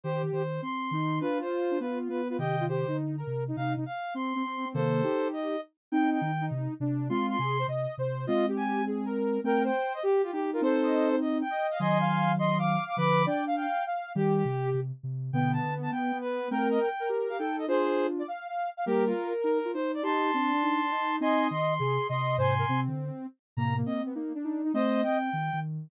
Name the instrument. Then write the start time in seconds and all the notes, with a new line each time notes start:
ocarina
0.04 D#3 G4 C5
0.23 D#3
0.32 D#3 C5
0.62 C4 C6
0.91 D#3 D#4
1.21 D4 F4 B4
1.41 C5
1.71 D4
1.80 B3 F4 B4
2.09 B3 B4
2.29 F4 B4
2.39 C3 D#3 G4 D#5 G5
2.60 F4
2.68 G4 C5
2.87 D3 D#4
3.17 A#4
3.27 C3
3.48 D#4
3.56 C3 D#4 F5
3.76 C3 D#4
3.86 F5
4.14 C4 C6
4.35 C4
4.45 C4
4.65 C4
4.74 C3 D#3 A#3 A4 C5
5.03 D#4 G4
5.33 D#5
5.92 C4 D#4 G5
6.12 G5
6.21 D#3
6.41 D#4
6.51 C3
6.80 C3 D4
7.09 G#3 C4 F4 C6
7.29 C6
7.39 C3 G#4
7.59 C5
7.67 C3 D#5
7.98 C3 C5
8.27 G#3 C4 F4 D#5
8.48 G4
8.57 G#5
8.87 G#4
9.06 A#4
9.44 A3 C4 A#4 G5
9.64 C5 G5
9.94 D#5
10.03 G4
10.23 F4 G4
10.33 D#4 G4
10.53 F4 A#4
10.61 C4 D#4 A4 C5
10.83 D#5
11.12 C5
11.21 D#5
11.41 G5
11.50 D#5
11.71 F5
11.79 D#3 F#3 D#5 G#5 C6
12.01 F5
12.39 D#5 C6
12.58 F5 D6
12.88 D6
12.97 D3 F3 B4 B5 D6
13.26 D4 D5 G5
13.47 F5
13.56 F5 G5
13.86 F5
14.15 D#3 G3 G4
14.35 G4
14.45 C3
14.74 C3
15.03 C3
15.33 B2 D3 B3 G5
15.53 A5
15.63 D3
15.83 A5
15.92 B3 G5
16.12 B3
16.21 B4
16.51 A3 C4 A#4 G5
16.71 D#5
16.80 G5
17.00 A#4
17.09 G4
17.29 G4 F5
17.38 D#4 A4 G5
17.58 D#5
17.68 D4 F4 G#4 C5
18.19 D5
18.28 F5
18.48 F5
18.77 F5
18.86 G3 A#3 G4 A#4
19.06 F4
19.44 D#4 A#4
19.65 F4
19.74 D#4 C5
19.94 D5
20.03 D#4 G4 A5 C6
20.34 C4 D4
20.53 D4
20.63 D#4
20.91 D#4
21.20 C4 D#4 D#5 G#5 C6
21.51 D#3 C6
21.79 C3 G#4
22.09 C3 D#5 C6
22.38 G#2 C3 C5 G#5 C6
22.59 A#4
22.69 C3 C4
22.88 D3
23.57 A2 C3 A#3 A#5
23.77 A#3
23.86 C4 D#5
24.06 B3
24.15 A#3 D#4
24.35 D4
24.44 D#4
24.64 D#4
24.74 A3 C4 C5 D#5
25.03 C4 G5
25.33 D#3
25.53 D#3